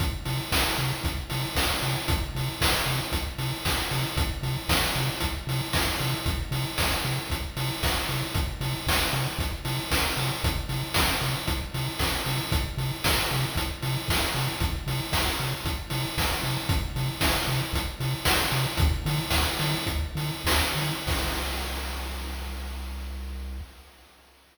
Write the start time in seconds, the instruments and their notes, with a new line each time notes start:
0.00 synth bass 1 C2, kick, closed hi-hat
0.25 synth bass 1 C3, open hi-hat
0.52 synth bass 1 C2, kick, snare
0.78 synth bass 1 C3, open hi-hat
1.03 synth bass 1 C2, kick, closed hi-hat
1.30 synth bass 1 C3, open hi-hat
1.55 synth bass 1 C2, kick, snare
1.82 synth bass 1 C3, open hi-hat
2.08 synth bass 1 C2, kick, closed hi-hat
2.35 synth bass 1 C3, open hi-hat
2.61 synth bass 1 C2, kick, snare
2.86 synth bass 1 C3, open hi-hat
3.12 synth bass 1 C2, kick, closed hi-hat
3.38 synth bass 1 C3, open hi-hat
3.65 synth bass 1 C2, kick, snare
3.91 synth bass 1 C3, open hi-hat
4.17 synth bass 1 C2, kick, closed hi-hat
4.43 synth bass 1 C3, open hi-hat
4.69 synth bass 1 C2, kick, snare
4.95 synth bass 1 C3, open hi-hat
5.20 synth bass 1 C2, kick, closed hi-hat
5.47 synth bass 1 C3, open hi-hat
5.73 synth bass 1 C2, kick, snare
6.00 synth bass 1 C3, open hi-hat
6.26 synth bass 1 C2, kick, closed hi-hat
6.51 synth bass 1 C3, open hi-hat
6.78 synth bass 1 C2, kick, snare
7.04 synth bass 1 C3, open hi-hat
7.30 synth bass 1 C2, kick, closed hi-hat
7.57 synth bass 1 C3, open hi-hat
7.83 synth bass 1 C2, kick, snare
8.09 synth bass 1 C3, open hi-hat
8.34 synth bass 1 C2, kick, closed hi-hat
8.61 synth bass 1 C3, open hi-hat
8.87 synth bass 1 C2, kick, snare
9.13 synth bass 1 C3, open hi-hat
9.38 synth bass 1 C2, kick, closed hi-hat
9.65 synth bass 1 C3, open hi-hat
9.91 synth bass 1 C2, kick, snare
10.17 synth bass 1 C3, open hi-hat
10.44 synth bass 1 C2, kick, closed hi-hat
10.69 synth bass 1 C3, open hi-hat
10.94 synth bass 1 C2, kick, snare
11.21 synth bass 1 C3, open hi-hat
11.47 synth bass 1 C2, kick, closed hi-hat
11.74 synth bass 1 C3, open hi-hat
11.99 synth bass 1 C2, kick, snare
12.25 synth bass 1 C3, open hi-hat
12.52 synth bass 1 C2, kick, closed hi-hat
12.77 synth bass 1 C3, open hi-hat
13.04 synth bass 1 C2, kick, snare
13.30 synth bass 1 C3, open hi-hat
13.55 synth bass 1 C2, kick, closed hi-hat
13.82 synth bass 1 C3, open hi-hat
14.08 synth bass 1 C2, kick, snare
14.34 synth bass 1 C3, open hi-hat
14.60 synth bass 1 C2, kick, closed hi-hat
14.87 synth bass 1 C3, open hi-hat
15.12 synth bass 1 C2, kick, snare
15.40 synth bass 1 C3, open hi-hat
15.65 synth bass 1 C2, kick, closed hi-hat
15.90 synth bass 1 C3, open hi-hat
16.17 synth bass 1 C2, kick, snare
16.43 synth bass 1 C3, open hi-hat
16.69 synth bass 1 C2, kick, closed hi-hat
16.96 synth bass 1 C3, open hi-hat
17.21 synth bass 1 C2, kick, snare
17.48 synth bass 1 C3, open hi-hat
17.73 synth bass 1 C2, kick, closed hi-hat
18.00 synth bass 1 C3, open hi-hat
18.25 synth bass 1 C2, kick, snare
18.52 synth bass 1 C3, open hi-hat
18.77 synth bass 1 D2, kick, closed hi-hat
19.05 synth bass 1 D3, open hi-hat
19.30 synth bass 1 D2, kick, snare
19.59 synth bass 1 D3, open hi-hat
19.86 synth bass 1 D2, kick, closed hi-hat
20.15 synth bass 1 D3, open hi-hat
20.45 synth bass 1 D2, kick, snare
20.75 synth bass 1 D3, open hi-hat
21.07 synth bass 1 C2, kick, crash